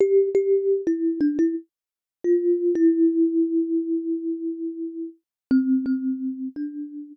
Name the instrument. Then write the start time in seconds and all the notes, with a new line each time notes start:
kalimba
0.00 G4
0.35 G4
0.87 E4
1.21 D4
1.39 E4
2.24 F4
2.75 E4
5.51 C4
5.86 C4
6.56 D4